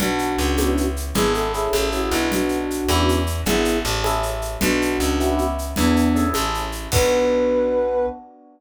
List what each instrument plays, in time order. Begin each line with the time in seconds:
0.00 electric bass (finger) B1, electric piano 1 B3 D4 F#4, flute D4 F#4, low conga, shaker
0.19 shaker
0.38 electric bass (finger) C#2, shaker
0.57 electric piano 1 B3 C#4 E4 G4, high conga, shaker
0.77 shaker
0.96 shaker
1.14 electric bass (finger) G#1, electric piano 1 B3 D4 E4 G#4, flute G#4, low conga, shaker
1.34 flute A4, shaker
1.54 electric piano 1 C#4 E4 G#4 A4, flute G#4, shaker
1.73 electric bass (finger) A1, high conga, shaker
1.92 electric piano 1 C#4 E4 G#4 A4, flute F#4, shaker
2.11 electric bass (finger) B1, electric piano 1 B3 D4 F#4, flute E4, shaker
2.30 flute D4 F#4, low conga, shaker
2.49 shaker
2.71 shaker
2.88 electric bass (finger) E2, electric piano 1 B3 C#4 E4 G4, high conga, shaker
3.09 shaker
3.27 shaker
3.46 electric bass (finger) G#1, electric piano 1 B3 D4 E4 G#4, flute E4 G#4, low conga, shaker
3.65 shaker
3.85 electric bass (finger) A1, shaker
4.04 electric piano 1 C#4 E4 G#4 A4, high conga, shaker
4.23 shaker
4.42 shaker
4.61 electric bass (finger) B1, electric piano 1 B3 D4 F#4, flute D4 F#4, low conga, shaker
4.82 shaker
5.00 electric bass (finger) C#2, shaker
5.20 electric piano 1 B3 C#4 E4 G4, shaker
5.38 shaker
5.58 shaker
5.76 electric bass (finger) E2, flute B3 D4, electric piano 1 B3 D4 E4 G#4, low conga, shaker
5.96 shaker
6.15 electric piano 1 C#4 E4 G#4 A4, shaker
6.34 electric bass (finger) A1, high conga, shaker
6.54 shaker
6.72 shaker
6.92 electric bass (finger) B1, electric piano 1 B3 D4 F#4, flute B4, kick, crash